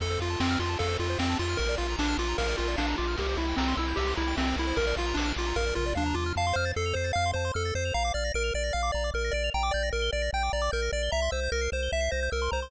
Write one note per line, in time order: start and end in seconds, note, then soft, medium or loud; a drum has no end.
0.00 0.18 F2 medium
0.00 0.09 A4 medium
0.00 0.20 A4 medium
0.00 kick medium
0.00 ride medium
0.10 0.19 C5 medium
0.19 0.36 F2 medium
0.19 0.40 F4 medium
0.19 0.29 F5 medium
0.19 ride medium
0.30 0.39 A5 medium
0.39 0.57 F2 medium
0.39 0.59 C4 medium
0.39 0.48 C6 medium
0.39 snare loud
0.50 0.59 F6 medium
0.59 0.76 F2 medium
0.59 0.78 F4 medium
0.59 0.69 C6 medium
0.59 ride medium
0.69 0.78 A5 medium
0.79 0.97 F2 medium
0.79 0.97 A4 medium
0.79 0.88 F5 medium
0.79 kick medium
0.79 ride medium
0.89 0.98 C5 medium
0.99 1.16 F2 medium
0.99 1.18 F4 medium
0.99 1.08 A4 medium
0.99 ride soft
1.10 1.19 C5 medium
1.18 1.36 F2 medium
1.18 1.38 C4 medium
1.18 1.27 F5 medium
1.18 snare medium
1.29 1.38 A5 medium
1.39 1.56 F2 medium
1.39 1.58 F4 medium
1.39 1.48 C6 medium
1.39 ride medium
1.49 1.58 F6 medium
1.57 1.76 A#1 medium
1.57 1.75 A#4 medium
1.57 1.67 A#4 medium
1.57 kick medium
1.57 ride medium
1.69 1.78 D5 medium
1.78 1.96 A#1 medium
1.78 1.96 F4 medium
1.78 1.87 F5 medium
1.78 ride medium
1.90 1.99 A#5 medium
1.99 2.15 A#1 medium
1.99 2.17 D4 medium
1.99 2.08 D6 medium
1.99 snare medium
2.08 2.17 F6 medium
2.18 2.35 A#1 medium
2.18 2.37 F4 medium
2.18 2.28 D6 medium
2.18 ride medium
2.28 2.37 A#5 medium
2.38 2.55 A#1 medium
2.38 2.56 A#4 medium
2.38 2.47 F5 medium
2.38 kick medium
2.38 ride medium
2.48 2.57 D5 medium
2.57 2.76 A#1 medium
2.57 2.76 F4 medium
2.57 2.68 A#4 medium
2.57 ride medium
2.68 2.77 D5 medium
2.77 2.95 A#1 medium
2.77 2.96 D4 medium
2.77 2.86 F5 medium
2.77 snare medium
2.88 2.97 A#5 medium
2.98 3.16 A#1 medium
2.98 3.16 F4 medium
2.98 3.07 D6 medium
2.98 ride medium
3.08 3.17 F6 medium
3.17 3.36 C2 medium
3.17 3.37 G4 medium
3.17 3.26 A#4 medium
3.17 kick medium
3.17 ride medium
3.29 3.38 C5 medium
3.37 3.54 C2 medium
3.37 3.56 E4 medium
3.37 3.46 E5 medium
3.37 ride medium
3.48 3.57 G5 medium
3.57 3.74 C2 medium
3.57 3.75 C4 medium
3.57 3.67 A#5 medium
3.57 snare medium
3.68 3.77 C6 medium
3.77 3.94 C2 medium
3.77 3.97 E4 medium
3.77 3.86 E6 medium
3.77 ride medium
3.88 3.97 G6 medium
3.96 4.14 C2 medium
3.96 4.14 G4 medium
3.96 4.07 E6 medium
3.96 kick medium
3.96 ride medium
4.07 4.16 C6 medium
4.16 4.35 C2 medium
4.16 4.36 E4 medium
4.16 4.25 A#5 medium
4.16 ride medium
4.28 4.37 G5 medium
4.37 4.54 C2 medium
4.37 4.56 C4 medium
4.37 4.46 E5 medium
4.37 snare medium
4.47 4.56 C5 medium
4.56 4.73 C2 medium
4.56 4.77 E4 medium
4.56 4.66 A#4 medium
4.56 ride medium
4.67 4.76 C5 medium
4.76 4.94 A#1 medium
4.76 4.86 A#4 medium
4.76 4.95 A#4 medium
4.76 kick medium
4.76 ride medium
4.87 4.96 D5 medium
4.96 5.13 A#1 medium
4.96 5.17 F4 medium
4.96 5.06 F5 medium
4.96 ride medium
5.07 5.16 A#5 medium
5.14 5.33 A#1 medium
5.14 5.33 D4 medium
5.14 5.26 D6 medium
5.14 snare medium
5.26 5.35 F6 medium
5.36 5.53 A#1 medium
5.36 5.57 F4 medium
5.36 5.46 D6 medium
5.36 ride medium
5.47 5.56 A#5 medium
5.56 5.73 A#1 medium
5.56 5.74 A#4 medium
5.56 5.65 F5 medium
5.56 kick medium
5.56 floor tom medium
5.67 5.76 D5 medium
5.75 5.94 A#1 medium
5.75 5.94 F4 medium
5.75 5.85 A#4 medium
5.75 mid tom medium
5.86 5.95 D5 medium
5.95 6.14 D#2 medium
5.95 6.15 D4 medium
5.95 6.04 F5 medium
5.95 high tom medium
6.06 6.15 A#5 medium
6.14 6.33 E2 medium
6.14 6.33 F4 medium
6.14 6.24 D6 medium
6.26 6.35 F6 medium
6.36 6.53 F2 medium
6.36 6.56 F5 medium
6.36 6.46 A5 loud
6.47 6.56 C6 medium
6.53 6.73 F2 medium
6.53 6.72 C5 medium
6.53 6.65 F6 medium
6.65 6.74 A6 medium
6.76 6.93 F2 medium
6.76 6.95 A4 medium
6.76 6.85 C7 medium
6.86 6.95 F7 medium
6.94 7.12 F2 medium
6.94 7.12 C5 medium
6.94 7.05 C7 medium
7.04 7.13 A6 medium
7.13 7.33 F2 medium
7.13 7.31 F5 medium
7.13 7.25 F6 loud
7.26 7.35 C6 medium
7.34 7.51 F2 medium
7.34 7.52 C5 medium
7.34 7.45 A5 medium
7.45 7.54 C6 medium
7.54 7.72 F2 medium
7.54 7.74 A4 medium
7.54 7.63 F6 medium
7.65 7.74 A6 medium
7.75 7.92 F2 medium
7.75 7.94 C5 medium
7.75 7.84 C7 medium
7.85 7.94 F7 medium
7.94 8.12 A#1 loud
7.94 8.13 F5 medium
7.94 8.03 A#5 loud
8.05 8.14 D6 medium
8.14 8.31 A#1 medium
8.14 8.32 D5 medium
8.14 8.24 F6 medium
8.25 8.33 A#6 medium
8.34 8.51 A#1 medium
8.34 8.54 A#4 medium
8.34 8.43 D7 medium
8.44 8.53 F7 medium
8.54 8.71 A#1 medium
8.54 8.73 D5 medium
8.54 8.63 D7 medium
8.64 8.73 A#6 medium
8.73 8.91 A#1 medium
8.73 8.91 F5 medium
8.73 8.82 F6 medium
8.83 8.92 D6 medium
8.92 9.11 A#1 medium
8.92 9.10 D5 medium
8.92 9.04 A#5 medium
9.04 9.13 D6 medium
9.14 9.31 A#1 medium
9.14 9.33 A#4 medium
9.14 9.23 F6 medium
9.24 9.33 A#6 medium
9.31 9.50 A#1 medium
9.31 9.50 D5 medium
9.31 9.43 D7 medium
9.44 9.53 F7 medium
9.54 9.71 A#1 medium
9.54 9.73 G5 medium
9.54 9.63 A#5 loud
9.63 9.72 D6 medium
9.71 9.91 A#1 medium
9.71 9.89 D5 medium
9.71 9.83 G6 medium
9.83 9.92 A#6 medium
9.93 10.10 A#1 medium
9.93 10.11 A#4 medium
9.93 10.03 D7 medium
10.02 10.11 G7 medium
10.13 10.30 A#1 medium
10.13 10.31 D5 medium
10.13 10.22 D7 medium
10.22 10.31 A#6 medium
10.33 10.50 A#1 medium
10.33 10.52 G5 medium
10.33 10.43 G6 medium
10.43 10.52 D6 medium
10.53 10.70 A#1 medium
10.53 10.71 D5 medium
10.53 10.62 A#5 medium
10.62 10.71 D6 medium
10.72 10.90 A#1 medium
10.72 10.91 A#4 medium
10.72 10.81 G6 medium
10.82 10.91 A#6 medium
10.92 11.09 A#1 medium
10.92 11.11 D5 medium
10.92 11.02 D7 medium
11.03 11.12 G7 medium
11.12 11.29 C2 medium
11.12 11.31 E5 medium
11.12 11.21 A#5 loud
11.22 11.31 C6 medium
11.31 11.49 C2 medium
11.31 11.50 C5 medium
11.31 11.40 E6 medium
11.43 11.52 G6 medium
11.52 11.69 C2 medium
11.52 11.70 A#4 medium
11.52 11.61 A#6 medium
11.61 11.70 C7 medium
11.72 11.89 C2 medium
11.72 11.91 C5 medium
11.72 11.81 E7 medium
11.83 11.92 G7 medium
11.92 12.09 C2 medium
11.92 12.11 E5 medium
11.92 12.01 E7 medium
12.01 12.10 C7 medium
12.11 12.29 C2 medium
12.11 12.30 C5 medium
12.11 12.20 A#6 medium
12.23 12.32 G6 medium
12.31 12.49 C2 medium
12.31 12.51 A#4 medium
12.31 12.40 E6 medium
12.42 12.51 C6 medium
12.51 12.69 C2 medium
12.51 12.71 C5 medium
12.51 12.60 A#5 medium
12.62 12.71 C6 medium